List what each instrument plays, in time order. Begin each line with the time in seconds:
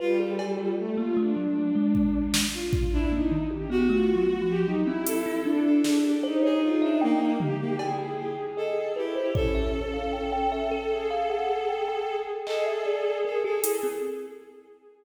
0.00 violin G3 F4, kalimba B4
0.19 kalimba G#4, violin A4
0.39 cowbell
0.58 kalimba F4
0.78 violin A3
0.97 kalimba A#3, violin F4
1.17 kalimba A3, violin D4
1.36 kalimba F#3
1.75 kalimba G#3
1.95 kick
2.34 snare
2.54 violin F4
2.73 kick
2.92 violin D4 E4
3.11 kalimba A#3, violin D#4
3.31 kalimba D#3
3.50 violin G4, high tom
3.70 kalimba B3, violin F#4
3.89 kalimba A3, violin F4
4.16 kalimba F#3
4.27 violin F#4
4.42 kalimba F3
4.49 violin G4
4.65 kalimba F#3, violin D#4
4.85 kalimba C4, violin E4
5.06 violin A4, closed hi-hat
5.26 kalimba E4
5.44 violin D4, kalimba D4
5.64 violin A4
5.84 kalimba G#4, snare
6.04 violin G4
6.23 violin D#4, kalimba C5
6.43 violin G#4, kalimba C#5
6.63 violin F4
6.82 violin D4, kalimba E5
7.01 violin A#3, kalimba G5
7.21 kalimba G5
7.40 violin G#3 G4, floor tom
7.60 violin A#3
7.79 violin E4 G#4, kalimba G5, cowbell
7.99 kalimba G5
8.18 violin G4
8.57 violin A4, kalimba D#5
8.95 violin E4 G4, kalimba B4
9.16 kalimba C5
9.35 violin C#4 A4, kalimba C#5, kick
9.55 kalimba E5
9.94 kalimba F5
10.13 kalimba G5
10.32 kalimba G5
10.52 kalimba E5
10.71 kalimba A4
10.91 violin G#4
11.11 kalimba F5
11.30 kalimba F#5
11.69 kalimba G5
11.88 kalimba G5
12.46 violin G#4 A4, kalimba D#5, clap
12.66 kalimba E5
12.86 kalimba D5
13.24 violin A4, kalimba A#4
13.43 kalimba G4, violin A4
13.64 kalimba E4, closed hi-hat
13.83 kalimba C4